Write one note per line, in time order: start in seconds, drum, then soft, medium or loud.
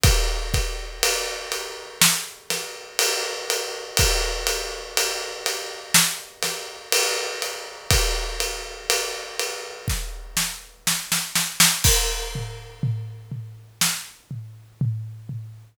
0.03 kick loud
0.03 ride loud
0.54 kick medium
0.54 ride medium
1.03 ride loud
1.52 ride medium
2.01 snare loud
2.50 snare medium
2.50 ride medium
2.99 ride loud
3.50 ride medium
3.97 kick loud
3.97 ride loud
4.47 ride medium
4.97 ride medium
5.46 ride medium
5.94 snare loud
6.43 snare medium
6.43 ride medium
6.92 ride loud
7.42 ride medium
7.91 kick loud
7.91 ride loud
8.40 ride medium
8.90 ride medium
9.39 ride medium
9.88 kick medium
9.88 snare medium
10.37 snare medium
10.87 snare medium
11.12 snare medium
11.35 snare medium
11.60 snare loud
11.84 kick medium
11.84 crash loud
12.35 floor tom medium
12.83 floor tom medium
13.32 floor tom medium
13.81 snare medium
14.31 floor tom medium
14.81 floor tom medium
15.29 floor tom medium